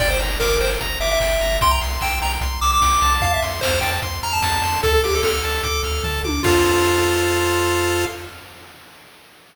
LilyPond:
<<
  \new Staff \with { instrumentName = "Lead 1 (square)" } { \time 4/4 \key f \major \tempo 4 = 149 d''16 c''16 r8 bes'8 c''16 r8. e''16 e''4~ e''16 | c'''16 bes''16 r8 g''8 bes''16 r8. d'''16 d'''4~ d'''16 | f''16 e''16 r8 c''8 g''16 r8. bes''16 a''4~ a''16 | a'16 a'16 g'16 a'16 a'2~ a'8 r8 |
f'1 | }
  \new Staff \with { instrumentName = "Lead 1 (square)" } { \time 4/4 \key f \major g''8 bes''8 d'''8 g''8 bes''8 d'''8 g''8 bes''8 | g''8 c'''8 e'''8 g''8 c'''8 e'''8 g''8 a''8~ | a''8 c'''8 f'''8 a''8 c'''8 f'''8 a''8 c'''8 | a''8 d'''8 f'''8 a''8 d'''8 f'''8 a''8 d'''8 |
<a' c'' f''>1 | }
  \new Staff \with { instrumentName = "Synth Bass 1" } { \clef bass \time 4/4 \key f \major g,,8 g,,8 g,,8 g,,8 g,,8 g,,8 g,,8 g,,8 | c,8 c,8 c,8 c,8 c,8 c,8 c,8 c,8 | f,8 f,8 f,8 f,8 f,8 f,8 f,8 f,8 | d,8 d,8 d,8 d,8 d,8 d,8 d,8 d,8 |
f,1 | }
  \new DrumStaff \with { instrumentName = "Drums" } \drummode { \time 4/4 <cymc bd>8 hho8 <bd sn>8 hho8 <hh bd>8 hho8 <hc bd>8 hho8 | <hh bd>8 hho8 <hc bd>8 hho8 <hh bd>8 hho8 <bd sn>8 hho8 | <hh bd>8 hho8 <bd sn>8 hho8 <hh bd>8 hho8 <bd sn>8 hho8 | <hh bd>8 hho8 <bd sn>8 hho8 <hh bd>8 hho8 <bd tomfh>8 tommh8 |
<cymc bd>4 r4 r4 r4 | }
>>